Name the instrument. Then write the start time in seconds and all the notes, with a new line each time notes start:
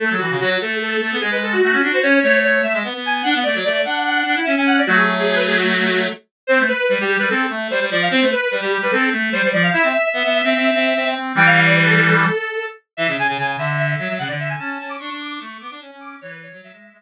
clarinet
0.00 A3 A4
0.10 F#3
0.18 E3 F#4
0.30 C#3
0.40 F#3 F#4
0.50 F#4
0.61 A3 A4
0.82 A4
0.91 A4
1.01 A3
1.11 B3
1.20 G#3 G#4
1.31 G#3 B4
1.43 A4
1.52 F#4
1.62 A3 F#4
1.72 C#4
1.82 D4 F#4
1.93 F#4 C5
2.02 C#4 C#5
2.23 A3 C#5
2.44 C#5
2.63 A3 E5
2.74 G#3
2.84 B3
2.94 B3
3.05 G#5
3.23 D4 F#5
3.35 B3
3.43 A3 D5
3.55 F#3
3.64 A3 D5
3.73 D5
3.85 D4 F#5
4.06 F#5
4.15 F#5
4.26 D4
4.36 E4
4.44 C#4 E5
4.56 C#4 G#5
4.66 F#5
4.78 D5
4.87 F#3 A3 F#4
4.97 G#4
5.19 G#4
5.35 B4
5.47 G#4
5.58 F#4
6.47 C4 C5
6.59 A3
6.68 B4
6.78 B4
6.89 G3
6.99 G3 G4
7.19 G3 B4
7.30 C4 A4
7.50 A3
7.70 G3 C5
7.80 G3
7.91 F3 D5
8.02 F5
8.11 C4 C5
8.21 A3
8.32 B4
8.41 B4
8.51 G3
8.61 G3 G4
8.82 G3 B4
8.91 C4 A4
9.12 A3
9.32 G3 C5
9.43 G3
9.52 F3 D5
9.63 F5
9.73 E4 E5
9.83 C4
10.13 B3
10.24 B3
10.44 C4
10.54 C4
10.74 C4
10.95 C4
11.05 C4
11.15 C4
11.35 E3 G3 G5
11.46 F5
11.66 D5
11.77 B4
11.85 A4
11.97 A4
12.97 E3 E5
13.08 C#3
13.18 C#3 G#5
13.28 C#3
13.38 C#3 G#5
13.47 G#5
13.58 D3 E5
13.77 E5
13.87 E5
13.99 F#3
14.09 F#3
14.18 C#3 F#5
14.27 D3 D5
14.39 E5
14.49 G#5
14.59 C#4 A5
14.80 C#4 A5
14.89 D6
14.99 D4 C#6
15.10 D4
15.20 D6
15.38 A3 C#6
15.60 B3 D6
15.71 D4
15.81 C#4
15.91 C#4
16.00 D6
16.21 E3 C#5
16.30 B4
16.43 C#5
16.52 F#3
16.62 F#3 E5
16.72 G#3 E5
16.93 G#3